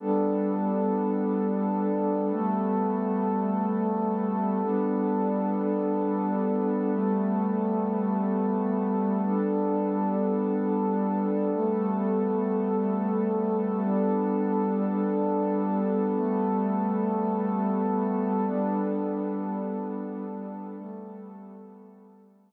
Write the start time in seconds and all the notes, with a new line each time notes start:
0.00 G3 B3 D4 A4
2.31 G3 A3 B3 A4
4.62 G3 B3 D4 A4
6.93 G3 A3 B3 A4
9.22 G3 B3 D4 A4
11.54 G3 A3 B3 A4
13.85 G3 B3 D4 A4
16.15 G3 A3 B3 A4
18.47 G3 B3 D4 A4
20.77 G3 A3 B3 A4